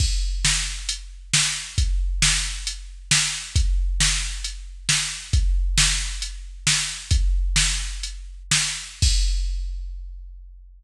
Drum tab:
CC |x-------|--------|--------|--------|
HH |----x---|x---x---|x---x---|x---x---|
SD |--o---o-|--o---o-|--o---o-|--o---o-|
BD |o-------|o-------|o-------|o-------|

CC |--------|x-------|
HH |x---x---|--------|
SD |--o---o-|--------|
BD |o-------|o-------|